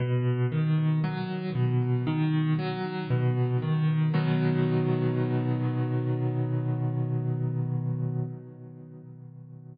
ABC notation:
X:1
M:4/4
L:1/8
Q:1/4=58
K:B
V:1 name="Acoustic Grand Piano" clef=bass
B,, D, F, B,, D, F, B,, D, | [B,,D,F,]8 |]